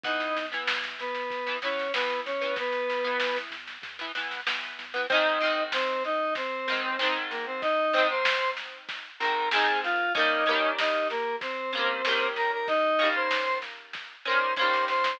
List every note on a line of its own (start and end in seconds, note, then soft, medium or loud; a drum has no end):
0.04 0.31 E2 loud
0.04 0.42 E3 medium
0.04 0.42 B3 medium
0.04 0.46 D#4 medium
0.04 0.46 D#5 medium
0.04 kick loud
0.04 snare medium
0.20 snare medium
0.36 0.63 E2 loud
0.36 snare medium
0.52 1.02 E3 medium
0.52 1.02 B3 medium
0.52 snare medium
0.67 0.95 E2 medium
0.67 snare loud
0.84 snare medium
0.99 1.26 E2 medium
0.99 1.57 B3 medium
0.99 1.57 B4 medium
0.99 snare medium
1.15 snare medium
1.30 1.57 E2 medium
1.30 kick medium
1.30 snare medium
1.46 1.59 E3 medium
1.46 1.59 B3 medium
1.46 snare medium
1.62 1.89 E2 medium
1.62 1.88 E3 medium
1.62 1.88 B3 medium
1.62 1.92 C#4 medium
1.62 1.92 C#5 medium
1.62 snare medium
1.79 snare medium
1.94 2.21 E2 medium
1.94 2.32 E3 medium
1.94 2.21 B3 medium
1.94 2.32 B3 medium
1.94 2.21 B4 medium
1.94 snare loud
2.10 snare medium
2.26 2.52 E2 medium
2.26 2.54 C#4 medium
2.26 2.54 C#5 medium
2.26 snare medium
2.41 2.92 E3 medium
2.41 2.92 B3 medium
2.41 snare medium
2.56 2.84 E2 medium
2.56 3.37 B3 medium
2.56 3.37 B4 medium
2.56 kick loud
2.56 snare medium
2.72 snare medium
2.89 3.16 E2 loud
2.89 snare medium
3.04 3.55 E3 medium
3.04 3.55 B3 medium
3.04 snare medium
3.20 3.47 E2 medium
3.20 snare loud
3.36 snare medium
3.51 3.78 E2 medium
3.51 snare medium
3.68 snare medium
3.82 4.09 E2 medium
3.82 kick medium
3.82 snare medium
3.99 4.12 E3 medium
3.99 4.12 B3 medium
3.99 snare medium
4.15 4.42 E2 medium
4.15 4.40 E3 medium
4.15 4.40 B3 medium
4.15 snare medium
4.31 snare medium
4.46 4.73 E2 medium
4.46 4.84 E3 medium
4.46 4.84 B3 medium
4.46 snare loud
4.63 snare medium
4.78 5.05 E2 medium
4.78 snare medium
4.94 5.06 E3 medium
4.94 5.06 B3 medium
4.94 snare medium
5.10 5.39 G#2 loud
5.10 5.39 D#3 loud
5.10 5.39 C4 loud
5.10 5.64 D#4 medium
5.10 5.64 D#5 medium
5.10 kick loud
5.10 snare medium
5.41 6.58 D#3 medium
5.41 6.58 C4 medium
5.41 snare medium
5.45 6.58 G#2 medium
5.72 6.03 C4 medium
5.72 6.03 C5 medium
5.72 snare loud
6.04 6.34 D#4 medium
6.04 6.34 D#5 medium
6.04 snare medium
6.35 7.18 C4 medium
6.35 7.18 C5 medium
6.35 kick medium
6.35 snare medium
6.68 6.97 G#2 medium
6.68 6.97 D#3 medium
6.68 6.97 C4 medium
6.68 snare medium
6.99 7.86 G#2 medium
6.99 7.86 D#3 medium
6.99 7.86 C4 medium
6.99 snare loud
7.30 7.45 A#3 medium
7.30 7.45 A#4 medium
7.30 snare medium
7.46 7.61 C4 medium
7.46 7.61 C5 medium
7.62 8.07 D#4 medium
7.62 8.07 D#5 medium
7.62 kick loud
7.62 snare medium
7.93 9.10 D#3 medium
7.93 9.10 C4 medium
7.93 snare medium
7.98 9.10 G#2 medium
8.10 8.51 C5 medium
8.10 8.51 C6 medium
8.25 snare loud
8.57 snare medium
8.89 kick medium
8.89 snare loud
9.20 9.49 D#3 medium
9.20 9.49 C4 medium
9.20 9.49 A#4 medium
9.20 9.49 A#5 medium
9.20 snare medium
9.24 9.49 G#2 medium
9.51 10.10 D#3 medium
9.51 10.10 C4 medium
9.51 9.80 G#4 medium
9.51 9.80 G#5 medium
9.51 snare loud
9.56 10.10 G#2 loud
9.84 10.13 F4 medium
9.84 10.13 F5 medium
9.84 snare medium
10.15 10.44 A#3 loud
10.15 10.44 C#4 loud
10.15 10.71 D#4 medium
10.15 10.71 D#5 medium
10.15 kick loud
10.15 snare medium
10.19 10.44 D#3 medium
10.19 10.44 G3 medium
10.46 11.63 A#3 loud
10.46 11.63 C#4 medium
10.46 snare medium
10.51 11.63 D#3 medium
10.51 11.63 G3 medium
10.79 11.08 D#4 medium
10.79 11.08 D#5 medium
10.79 snare loud
11.10 11.36 A#3 medium
11.10 11.36 A#4 medium
11.10 snare medium
11.41 12.28 C4 medium
11.41 12.28 C5 medium
11.41 kick loud
11.41 snare medium
11.73 12.02 A#3 medium
11.73 12.02 C#4 medium
11.73 snare medium
11.77 12.02 D#3 medium
11.77 12.02 G3 medium
12.05 12.92 G3 medium
12.05 12.92 A#3 loud
12.05 12.92 C#4 medium
12.05 snare loud
12.11 12.92 D#3 medium
12.36 12.51 A#4 medium
12.36 12.51 A#5 medium
12.36 snare medium
12.53 12.68 A#4 medium
12.53 12.68 A#5 medium
12.68 13.09 D#4 medium
12.68 13.09 D#5 medium
12.68 kick loud
12.68 snare medium
12.99 14.15 A#3 medium
12.99 14.15 C#4 medium
12.99 snare medium
13.03 14.15 D#3 loud
13.03 14.15 G3 medium
13.15 13.58 C5 medium
13.15 13.58 C6 medium
13.31 snare loud
13.62 snare medium
13.93 kick medium
13.93 snare medium
14.25 14.55 A#3 medium
14.25 14.55 C#4 medium
14.25 14.54 C5 medium
14.25 14.54 C6 medium
14.25 snare medium
14.29 14.55 D#3 medium
14.29 14.55 G3 medium
14.56 15.15 A#3 medium
14.56 15.15 C#4 medium
14.56 14.85 C5 medium
14.56 14.85 C6 medium
14.56 kick medium
14.56 snare medium
14.61 15.15 D#3 medium
14.61 15.15 G3 medium
14.73 snare medium
14.88 15.17 C5 medium
14.88 15.17 C6 medium
14.88 snare medium
15.04 snare loud